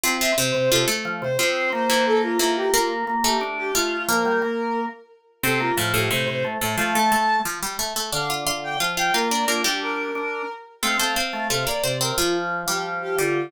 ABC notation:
X:1
M:4/4
L:1/8
Q:1/4=178
K:F
V:1 name="Violin"
z e c2 A z2 c | c2 c2 A F2 G | F z2 G z G F F | B5 z3 |
A F z G c c z2 | f a3 z4 | f z2 g z g B d | F G B5 z |
f2 f2 f d2 B | F z2 G z G F F |]
V:2 name="Pizzicato Strings"
[F,F] [F,F] [C,C]2 [F,F] [A,A]3 | [F,F]3 [E,E]3 [E,E]2 | [B,B]3 [A,A]3 [A,A]2 | [B,B]4 z4 |
[C,C]2 [A,,A,] [A,,A,] [A,,A,]3 [A,,A,] | [F,F] [A,A] [A,A]2 [F,F] [G,G] [A,A] [A,A] | [Dd] [Ff] [Ff]2 [Ff] [Ff] [Ff] [Dd] | [B,B] [G,G]4 z3 |
[A,A] [Cc] [Cc]2 [A,A] [B,B] [Cc] [Cc] | [F,F]3 [G,G]3 [G,G]2 |]
V:3 name="Drawbar Organ"
C2 C, C, C, z F, C, | C2 B,4 B,2 | B,2 B,2 D2 F2 | F, G, B,3 z3 |
C B, F,2 C, C, A, A, | A,4 z4 | D,2 D,2 F,2 B,2 | D D3 D2 z2 |
C A, z A, C, z C,2 | F,3 F,3 D,2 |]